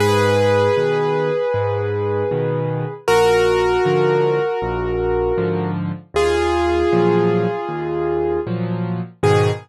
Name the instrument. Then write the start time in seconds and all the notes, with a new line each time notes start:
acoustic grand piano
0.00 G#2 G#4 B4
0.77 B2 D#3
1.54 G#2
2.31 B2 D#3
3.08 A#1 F#4 A#4
3.85 G#2 D3 F3
4.62 A#1
5.38 G#2 D3 F3
6.14 D#2 F4 G#4
6.92 A#2 F3 F#3
7.69 D#2
8.47 A#2 F3 F#3
9.23 G#2 B2 D#3 G#4